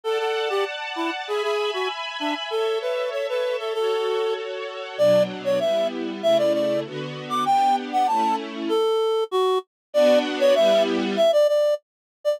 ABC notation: X:1
M:2/4
L:1/16
Q:1/4=97
K:D
V:1 name="Clarinet"
A A2 G z2 E z | ^G G2 F z2 D z | A2 B2 c B2 A | A4 z4 |
[K:Bm] d2 z c e2 z2 | e d d2 z3 d' | g2 z f a2 z2 | A4 F2 z2 |
d2 z c e2 z2 | e d d2 z3 d |]
V:2 name="String Ensemble 1"
[dfa]8 | [e^gb]8 | [Ace]8 | [FAc]8 |
[K:Bm] [B,,F,D]4 [G,B,E]4 | [C,A,E]4 [D,B,F]4 | [B,DG]4 [A,CE]4 | z8 |
[B,DF]4 [G,B,E]4 | z8 |]